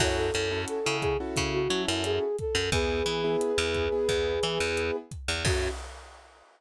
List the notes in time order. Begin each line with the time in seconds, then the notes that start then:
0.00 F#2 C#4 E4 F#4 A4 C#5, kick, cross-stick, crash
0.17 A4
0.34 F#2 C#4 E4 F#4 A4, closed hi-hat
0.52 C#4 E4 F#4 A4
0.68 A4, closed hi-hat
0.86 C#3 C#4 E4 F#4 A4
1.01 G#4, kick, cross-stick, closed hi-hat
1.20 C#4 E4 F#4 A4
1.36 C#3, kick, closed hi-hat
1.52 F#4
1.70 F#3 C#4 E4 F#4 A4, closed hi-hat
1.87 F#2 E4
2.04 G#4, cross-stick, closed hi-hat
2.38 A4, kick, closed hi-hat
2.55 F#2
2.72 E2 B3 E4 G#4 B4, kick, closed hi-hat
3.06 E3 B3 E4 G#4, closed hi-hat
3.24 B3 E4 G#4
3.41 cross-stick, closed hi-hat
3.58 E2 B3 E4 G#4
3.74 kick, closed hi-hat
3.92 B3 E4 G#4
4.09 E2, kick, closed hi-hat
4.43 E3 B3 E4 G#4, cross-stick, closed hi-hat
4.60 E2
4.77 closed hi-hat
5.11 kick, closed hi-hat
5.28 E2
5.45 F#2 C#4 E4 F#4 A4, kick, crash